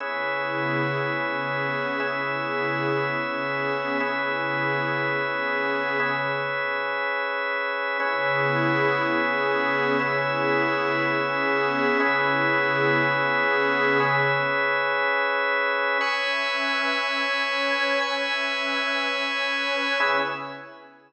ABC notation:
X:1
M:4/4
L:1/8
Q:1/4=120
K:C#m
V:1 name="Pad 5 (bowed)"
[C,B,EG]4 [C,B,CG]4 | [C,B,EG]4 [C,B,CG]4 | [C,B,EG]4 [C,B,CG]4 | z8 |
[C,B,EG]4 [C,B,CG]4 | [C,B,EG]4 [C,B,CG]4 | [C,B,EG]4 [C,B,CG]4 | z8 |
[CBeg]4 [CBcg]4 | [CBeg]4 [CBcg]4 | [C,B,EG]2 z6 |]
V:2 name="Drawbar Organ"
[CGBe]8 | [CGBe]8 | [CGBe]8 | [CGBe]8 |
[CGBe]8 | [CGBe]8 | [CGBe]8 | [CGBe]8 |
[cgbe']8 | [cgbe']8 | [CGBe]2 z6 |]